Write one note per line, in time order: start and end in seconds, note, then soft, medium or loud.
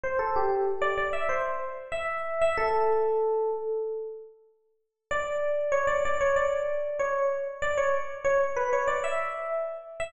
0.04 0.19 C5 medium
0.19 0.34 A4 medium
0.36 0.65 G4 medium
0.82 0.97 D5 loud
0.98 1.13 D5 medium
1.13 1.28 E5 medium
1.29 1.44 C5 medium
1.92 2.38 E5 medium
2.41 2.56 E5 medium
2.58 3.50 A4 loud
5.11 5.73 D5 loud
5.72 5.87 C#5 loud
5.87 6.02 D5 medium
6.05 6.20 D5 loud
6.21 6.36 C#5 medium
6.36 6.98 D5 medium
6.99 7.26 C#5 medium
7.62 7.77 D5 loud
7.78 7.93 C#5 medium
8.24 8.39 C#5 loud
8.56 8.71 B4 medium
8.73 8.88 C#5 medium
8.88 9.03 D5 medium
9.04 9.49 E5 medium
10.00 10.12 E5 loud